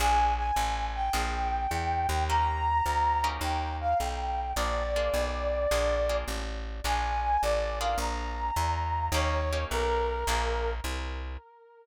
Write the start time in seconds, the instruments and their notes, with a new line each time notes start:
0.00 electric bass (finger) A#1, acoustic guitar (steel) A#3 D4 F4 G#4, brass section G#5
0.38 brass section G#5
0.56 electric bass (finger) A1
0.95 brass section G5
1.13 electric bass (finger) A#1, acoustic guitar (steel) A#3 D4 F4 G#4
1.71 electric bass (finger) E2
2.09 electric bass (finger) D#2
2.29 acoustic guitar (steel) A#3 C#4 D#4 G4, brass section A#5
2.86 electric bass (finger) D2
3.24 acoustic guitar (steel) A#3 C#4 D#4 G4
3.41 electric bass (finger) D#2, brass section G5
3.81 brass section F5
4.00 electric bass (finger) B1, brass section G5
4.56 electric bass (finger) A#1, acoustic guitar (steel) A#3 D4 F4 G#4, brass section D5
4.96 acoustic guitar (steel) A#3 D4 F4 G#4
5.14 electric bass (finger) B1
5.71 electric bass (finger) A#1, acoustic guitar (steel) A#3 D4 F4 G#4
6.09 acoustic guitar (steel) A#3 D4 F4 G#4
6.28 electric bass (finger) A1
6.84 electric bass (finger) A#1, acoustic guitar (steel) A#3 D4 F4 G#4, brass section G#5
7.42 electric bass (finger) A1, brass section D5
7.81 acoustic guitar (steel) A#3 D4 F4 G#4, brass section F5
7.98 electric bass (finger) A#1, brass section A#5
8.56 electric bass (finger) E2
9.12 electric bass (finger) D#2, acoustic guitar (steel) A#3 C#4 D#4 G4, brass section C#5
9.53 acoustic guitar (steel) A#3 C#4 D#4 G4
9.71 electric bass (finger) B1, brass section A#4
10.27 electric bass (finger) A#1, acoustic guitar (steel) A#3 D4 F4 G#4
10.84 electric bass (finger) C2